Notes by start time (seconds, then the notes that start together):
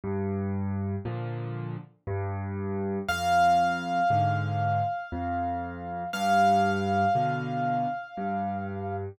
0.04 G2
1.05 A#2 D3 F3
2.07 G2
3.09 F2 F5
4.10 G#2 D3
5.12 F2
6.13 G2 F5
7.15 B2 D3
8.17 G2